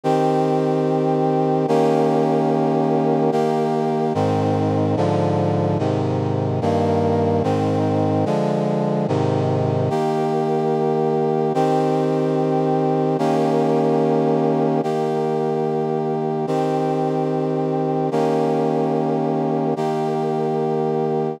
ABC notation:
X:1
M:4/4
L:1/8
Q:1/4=146
K:Eb
V:1 name="Brass Section"
[E,CG]8 | [E,B,_DG]8 | [E,B,G]4 [A,,E,C]4 | [A,,D,F,]4 [A,,C,E,]4 |
[G,,E,B,]4 [A,,E,C]4 | [D,F,A,]4 [A,,C,E,]4 | [E,B,G]8 | [E,CG]8 |
[E,B,_DG]8 | [E,B,G]8 | [E,CG]8 | [E,B,_DG]8 |
[E,B,G]8 |]